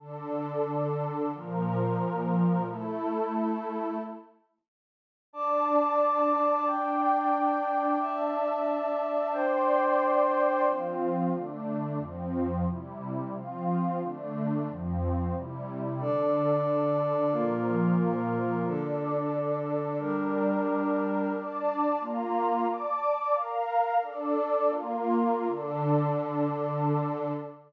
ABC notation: X:1
M:4/4
L:1/8
Q:1/4=180
K:Dm
V:1 name="Pad 2 (warm)"
[D,DA]8 | [B,,F,B]8 | [A,EA]8 | z8 |
[Dda]8 | [Ddg]8 | [Dea]8 | [dgc']8 |
[K:F] [F,CF]4 [D,A,D]4 | [F,,F,C]4 [C,G,E]4 | [F,CF]4 [D,A,D]4 | [F,,F,C]4 [C,G,E]4 |
[K:Dm] [D,DA]8 | [B,,F,B]8 | [DAd]8 | [G,DB]8 |
[Dda]4 [B,Fb]4 | [dad']4 [Bfb]4 | "^rit." [DAd]4 [B,FB]4 | [D,DA]8 |]
V:2 name="Pad 2 (warm)"
z8 | z8 | z8 | z8 |
[dad']8 | [Ddg]8 | [dea]8 | [Dcg]8 |
[K:F] z8 | z8 | z8 | z8 |
[K:Dm] [DAd]8 | [B,FB]8 | [D,DA]8 | [G,DB]8 |
z8 | z8 | "^rit." z8 | z8 |]